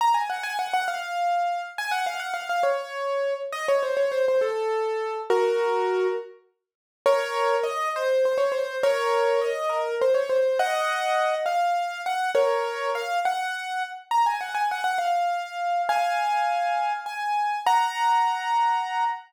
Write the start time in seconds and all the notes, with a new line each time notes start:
0.01 A#5
0.14 G#5
0.30 F#5
0.43 G#5
0.59 F#5
0.74 F#5
0.88 F5
1.78 G#5
1.91 F#5
2.06 F5
2.20 F#5
2.34 F5
2.49 F5
2.63 C#5
3.52 D#5
3.68 C#5
3.83 C5
3.97 C#5
4.12 C5
4.28 C5
4.41 A4
5.30 F#4 A#4
7.06 A#4 C#5
7.63 D#5
7.96 C5
8.25 C5
8.38 C#5
8.52 C5
8.83 A#4 C#5
9.41 D#5
9.69 A#4
10.01 C5
10.14 C#5
10.29 C5
10.59 D#5 F#5
11.46 F5
12.06 F#5
12.35 A#4 C#5
12.95 F5
13.25 F#5
14.11 A#5
14.26 G#5
14.41 F#5
14.55 G#5
14.71 F#5
14.84 F#5
14.98 F5
15.89 F5 G#5
17.06 G#5
17.67 F#5 A#5